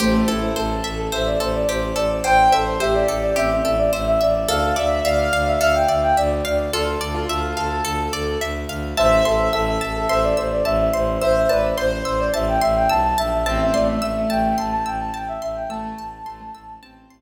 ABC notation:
X:1
M:4/4
L:1/16
Q:1/4=107
K:Am
V:1 name="Flute"
c2 A2 A3 A c d c d c2 d2 | c2 A2 e d2 d e2 e d e e d2 | f2 d2 d3 e e g e g d2 d2 | A12 z4 |
c2 A2 A3 A c d c d e2 c2 | e2 d2 c3 d e g e g a2 e2 | e e d e e2 g2 a a g a g e e g | a8 z8 |]
V:2 name="Acoustic Grand Piano"
A,2 E2 A4 e z7 | g2 c2 G4 C z7 | A2 e2 f4 f z7 | F z2 F3 A6 z4 |
e2 e2 e4 e z7 | c2 B z c4 z8 | C2 A,2 A,4 A, z7 | A,2 z2 A, A, z2 C2 z6 |]
V:3 name="Pizzicato Strings"
G2 A2 c2 e2 c2 A2 G2 A2 | c2 e2 c2 A2 G2 A2 c2 e2 | A2 d2 e2 f2 A2 d2 e2 f2 | A2 d2 e2 f2 A2 d2 e2 f2 |
a2 c'2 e'2 a2 c'2 e'2 a2 c'2 | e'2 a2 c'2 e'2 a2 c'2 e'2 a2 | a2 c'2 e'2 a2 c'2 e'2 a2 c'2 | e'2 a2 c'2 e'2 a2 c'2 z4 |]
V:4 name="Violin" clef=bass
A,,,2 A,,,2 A,,,2 A,,,2 A,,,2 A,,,2 A,,,2 A,,,2 | A,,,2 A,,,2 A,,,2 A,,,2 A,,,2 A,,,2 A,,,2 A,,,2 | D,,2 D,,2 D,,2 D,,2 D,,2 D,,2 D,,2 D,,2 | D,,2 D,,2 D,,2 D,,2 D,,2 D,,2 D,,2 D,,2 |
A,,,2 A,,,2 A,,,2 A,,,2 A,,,2 A,,,2 A,,,2 A,,,2 | A,,,2 A,,,2 A,,,2 A,,,2 A,,,2 A,,,2 B,,,2 _B,,,2 | A,,,2 A,,,2 A,,,2 A,,,2 A,,,2 A,,,2 A,,,2 A,,,2 | A,,,2 A,,,2 A,,,2 A,,,2 A,,,2 A,,,2 z4 |]